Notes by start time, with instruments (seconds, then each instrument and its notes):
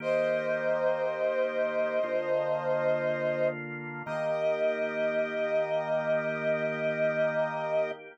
0.00 drawbar organ D#3 A#3 G4, brass section C5 D#5
2.03 drawbar organ D3 A#3 F4
4.06 drawbar organ D#3 A#3 G4, brass section D#5